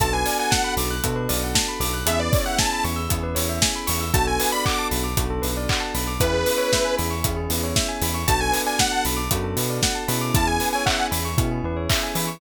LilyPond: <<
  \new Staff \with { instrumentName = "Lead 2 (sawtooth)" } { \time 4/4 \key b \dorian \tempo 4 = 116 a''16 gis''8 gis''16 fis''8 r2 r8 | e''16 d''8 fis''16 a''8 r2 r8 | a''16 gis''8 b''16 d'''8 r2 r8 | b'4. r2 r8 |
a''16 gis''8 gis''16 fis''8 r2 r8 | a''16 gis''8 gis''16 fis''8 r2 r8 | }
  \new Staff \with { instrumentName = "Electric Piano 2" } { \time 4/4 \key b \dorian <b d' fis' a'>2 <b d' fis' a'>2 | <b cis' e' gis'>2 <b cis' e' gis'>2 | <b d' fis' a'>2 <b d' fis' a'>2 | <b cis' e' gis'>2 <b cis' e' gis'>2 |
<b d' fis' a'>2 <b d' fis' a'>4. <b cis' e' gis'>8~ | <b cis' e' gis'>2 <b cis' e' gis'>2 | }
  \new Staff \with { instrumentName = "Tubular Bells" } { \time 4/4 \key b \dorian a'16 b'16 d''16 fis''16 a''16 b''16 d'''16 fis'''16 a'16 b'16 d''16 fis''16 a''16 b''16 d'''16 fis'''16 | gis'16 b'16 cis''16 e''16 gis''16 b''16 cis'''16 e'''16 gis'16 b'16 cis''16 e''16 gis''16 b''16 cis'''16 e'''16 | fis'16 a'16 b'16 d''16 fis''16 a''16 b''16 d'''16 fis'16 a'16 b'16 d''16 fis''16 a''16 b''16 d'''16 | e'16 gis'16 b'16 cis''16 e''16 gis''16 b''16 cis'''16 e'16 gis'16 b'16 cis''16 e''16 gis''16 b''16 cis'''16 |
fis'16 a'16 b'16 d''16 fis''16 a''16 b''16 d'''16 fis'16 a'16 b'16 d''16 fis''16 a''16 b''16 d'''16 | e'16 gis'16 b'16 cis''16 e''16 gis''16 b''16 cis'''16 e'16 gis'16 b'16 cis''16 e''16 gis''16 b''16 cis'''16 | }
  \new Staff \with { instrumentName = "Synth Bass 1" } { \clef bass \time 4/4 \key b \dorian b,,4. b,,8 b,8 b,,4 b,,8 | e,4. e,8 e,8 e,4 e,8 | b,,4. b,,8 b,,8 b,,4 b,,8 | e,4. e,8 e,8 e,4 e,8 |
b,,4. b,,8 fis,8 b,4 b,8 | e,4. e,8 b,8 e,4 e8 | }
  \new DrumStaff \with { instrumentName = "Drums" } \drummode { \time 4/4 <hh bd>8 hho8 <bd sn>8 hho8 <hh bd>8 hho8 <bd sn>8 hho8 | hh8 <hho bd>8 <bd sn>8 hho8 <hh bd>8 hho8 <bd sn>8 hho8 | <hh bd>8 hho8 <hc bd>8 hho8 <hh bd>8 hho8 <hc bd>8 hho8 | <hh bd>8 hho8 <bd sn>8 hho8 <hh bd>8 hho8 <bd sn>8 hho8 |
<hh bd>8 hho8 <bd sn>8 hho8 <hh bd>8 hho8 <bd sn>8 hho8 | <hh bd>8 hho8 <hc bd>8 hho8 <hh bd>4 <hc hho bd>8 hho8 | }
>>